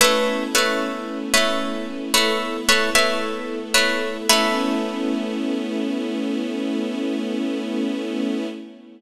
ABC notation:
X:1
M:4/4
L:1/16
Q:1/4=56
K:A
V:1 name="Orchestral Harp"
[A,Bce]2 [A,Bce]3 [A,Bce]3 [A,Bce]2 [A,Bce] [A,Bce]3 [A,Bce]2 | [A,Bce]16 |]
V:2 name="String Ensemble 1"
[A,B,CE]8 [A,B,EA]8 | [A,B,CE]16 |]